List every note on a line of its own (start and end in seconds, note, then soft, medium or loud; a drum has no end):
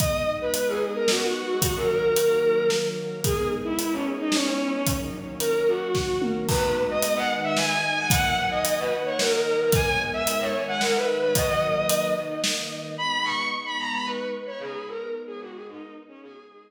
0.00 1.61 G#3 medium
0.00 1.61 B3 medium
0.00 1.61 D#4 medium
0.00 0.22 D#5 medium
0.00 kick loud
0.00 closed hi-hat medium
0.41 0.54 B4 medium
0.54 0.68 B4 medium
0.54 closed hi-hat medium
0.68 0.81 G#4 medium
0.95 1.08 A#4 medium
1.08 1.21 F#4 medium
1.08 snare loud
1.22 1.47 F#4 medium
1.49 1.62 F#4 medium
1.62 3.22 D#3 medium
1.62 3.22 F#3 medium
1.62 3.22 A#3 medium
1.62 1.75 F#4 medium
1.62 kick medium
1.62 closed hi-hat loud
1.76 1.89 A#4 medium
1.89 2.67 A#4 medium
2.16 closed hi-hat medium
2.70 snare medium
3.24 4.85 G#3 medium
3.24 4.85 B3 medium
3.24 4.85 D#4 medium
3.24 3.48 G#4 medium
3.24 kick loud
3.24 closed hi-hat medium
3.64 3.77 E4 medium
3.79 3.92 E4 medium
3.79 closed hi-hat medium
3.92 4.05 C#4 medium
4.19 4.32 D#4 medium
4.32 4.45 C#4 medium
4.32 snare loud
4.46 4.70 C#4 medium
4.74 4.87 C#4 medium
4.86 6.48 D#3 medium
4.86 6.48 F#3 medium
4.86 6.48 A#3 medium
4.86 kick medium
4.86 closed hi-hat loud
5.40 5.62 A#4 medium
5.40 closed hi-hat medium
5.68 6.20 F#4 medium
5.95 kick medium
5.95 snare medium
6.22 mid tom loud
6.48 7.29 G#3 medium
6.48 7.29 B3 medium
6.48 7.29 D#4 medium
6.48 6.75 B4 medium
6.48 kick loud
6.48 crash loud
6.90 7.02 D#5 medium
7.02 7.16 D#5 medium
7.02 closed hi-hat medium
7.16 7.28 F#5 medium
7.30 8.10 D#3 medium
7.30 8.10 G#3 medium
7.30 8.10 D#4 loud
7.44 7.56 E5 medium
7.56 7.69 G#5 medium
7.56 snare medium
7.70 7.96 G#5 medium
7.97 8.10 G#5 medium
8.10 8.90 D#3 medium
8.10 8.91 F#3 medium
8.10 8.90 A#3 medium
8.10 8.35 F#5 loud
8.10 kick loud
8.10 closed hi-hat loud
8.51 8.64 D#5 medium
8.65 8.78 D#5 medium
8.65 closed hi-hat loud
8.79 8.91 B4 medium
8.91 9.71 D#3 medium
8.91 9.71 A#3 medium
8.91 9.71 D#4 medium
9.05 9.18 C#5 medium
9.18 9.31 A#4 medium
9.18 snare loud
9.32 9.57 A#4 medium
9.60 9.73 A#4 medium
9.72 10.53 G#3 loud
9.72 10.53 B3 medium
9.72 10.53 D#4 medium
9.72 9.97 G#5 medium
9.72 kick loud
9.72 closed hi-hat medium
10.13 10.26 E5 medium
10.27 10.40 E5 medium
10.27 closed hi-hat medium
10.40 10.53 C#5 medium
10.54 11.34 D#3 medium
10.54 11.34 G#3 loud
10.54 11.34 D#4 loud
10.68 10.81 F#5 medium
10.80 10.93 A#4 medium
10.80 snare medium
10.95 11.18 B4 medium
11.22 11.35 B4 medium
11.34 12.15 D#3 medium
11.34 12.15 F#3 loud
11.34 12.15 A#3 medium
11.34 11.47 D#5 medium
11.34 kick medium
11.34 closed hi-hat loud
11.49 12.04 D#5 medium
11.89 closed hi-hat loud
12.16 12.97 D#3 medium
12.16 12.97 A#3 medium
12.16 12.97 D#4 loud
12.44 snare loud
12.98 16.19 G#3 medium
12.98 16.19 B3 loud
12.98 16.19 D#4 medium
12.98 13.23 B5 medium
13.24 13.46 C#6 medium
13.65 13.78 B5 medium
13.78 13.91 A#5 medium
13.92 14.05 B5 medium
14.05 14.30 B4 medium
14.46 14.59 C#5 medium
14.59 14.84 G#4 medium
14.87 15.09 A#4 medium
15.27 15.40 G#4 medium
15.40 15.53 F#4 medium
15.54 15.67 G#4 medium
15.67 15.93 D#4 medium
16.08 16.21 C#4 medium
16.22 16.71 G#3 medium
16.22 16.71 B3 medium
16.22 16.71 D#4 medium
16.22 16.46 G#4 medium
16.50 16.71 G#4 medium